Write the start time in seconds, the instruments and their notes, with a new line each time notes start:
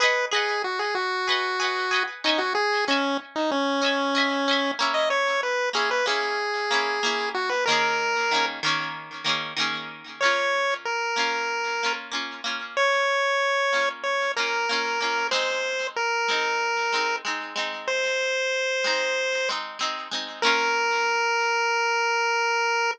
0.00 acoustic guitar (steel) G#4 B4 D#5, lead 1 (square) B4
0.05 acoustic guitar (steel) F#5
0.31 acoustic guitar (steel) G#4 B4 D#5, lead 1 (square) G#4
0.36 acoustic guitar (steel) F#5
0.64 lead 1 (square) F#4
0.79 lead 1 (square) G#4
0.95 lead 1 (square) F#4
1.27 acoustic guitar (steel) G#4 B4 D#5
1.32 acoustic guitar (steel) F#5
1.59 acoustic guitar (steel) G#4 B4 D#5
1.64 acoustic guitar (steel) F#5
1.91 acoustic guitar (steel) G#4 B4 D#5
1.96 acoustic guitar (steel) F#5
2.24 acoustic guitar (steel) C#4 D#5 E5, lead 1 (square) D#4
2.29 acoustic guitar (steel) G#5
2.38 lead 1 (square) F#4
2.55 lead 1 (square) G#4
2.87 acoustic guitar (steel) C#4 D#5 E5, lead 1 (square) C#4
2.92 acoustic guitar (steel) G#5
3.36 lead 1 (square) D#4
3.51 lead 1 (square) C#4
3.81 acoustic guitar (steel) C#4 D#5 E5
3.86 acoustic guitar (steel) G#5
4.15 acoustic guitar (steel) C#4 D#5 E5
4.19 acoustic guitar (steel) G#5
4.48 acoustic guitar (steel) C#4 D#5 E5
4.53 acoustic guitar (steel) G#5
4.79 acoustic guitar (steel) A#3 C#4 E4
4.94 lead 1 (square) D#5
5.10 lead 1 (square) C#5
5.43 lead 1 (square) B4
5.73 acoustic guitar (steel) A#3 C#4 E4, lead 1 (square) G#4
5.91 lead 1 (square) B4
6.06 acoustic guitar (steel) A#3 C#4 E4, lead 1 (square) G#4
6.70 acoustic guitar (steel) A#3 C#4 E4
7.03 acoustic guitar (steel) A#3 C#4 E4
7.34 lead 1 (square) F#4
7.49 lead 1 (square) B4
7.66 acoustic guitar (steel) D#3 A#3, lead 1 (square) A#4
7.70 acoustic guitar (steel) C#4 G#4
8.31 acoustic guitar (steel) D#3 A#3 C#4
8.36 acoustic guitar (steel) G#4
8.63 acoustic guitar (steel) D#3 A#3 C#4
8.68 acoustic guitar (steel) G#4
9.24 acoustic guitar (steel) D#3 A#3 C#4
9.29 acoustic guitar (steel) G#4
9.56 acoustic guitar (steel) D#3 A#3 C#4
9.61 acoustic guitar (steel) G#4
10.21 acoustic guitar (steel) A#3 C#4, lead 1 (square) C#5
10.25 acoustic guitar (steel) F4
10.85 lead 1 (square) A#4
11.16 acoustic guitar (steel) A#3 C#4 F4
11.83 acoustic guitar (steel) A#3 C#4 F4
12.11 acoustic guitar (steel) A#3 C#4 F4
12.44 acoustic guitar (steel) A#3 C#4 F4
12.77 lead 1 (square) C#5
13.72 acoustic guitar (steel) A#3 C#4 F4
14.03 lead 1 (square) C#5
14.36 acoustic guitar (steel) A#3 C#4 F4, lead 1 (square) A#4
14.69 acoustic guitar (steel) A#3 C#4 F4
15.00 acoustic guitar (steel) A#3 C#4 F4
15.31 acoustic guitar (steel) G#3 C4 D#4, lead 1 (square) C5
15.96 lead 1 (square) A#4
16.28 acoustic guitar (steel) G#3 C4 D#4
16.92 acoustic guitar (steel) G#3 C4 D#4
17.25 acoustic guitar (steel) G#3 C4 D#4
17.55 acoustic guitar (steel) G#3 C4 D#4
17.88 lead 1 (square) C5
18.84 acoustic guitar (steel) G#3 C4 D#4
19.49 acoustic guitar (steel) G#3 C4 D#4
19.79 acoustic guitar (steel) G#3 C4 D#4
20.11 acoustic guitar (steel) G#3 C4 D#4
20.42 acoustic guitar (steel) A#3 C#4 F4, lead 1 (square) A#4